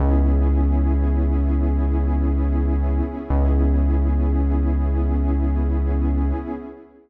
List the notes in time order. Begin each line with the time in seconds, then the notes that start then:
0.00 C#2 B3 C#4 E4 G#4
3.29 C#2 B3 C#4 E4 G#4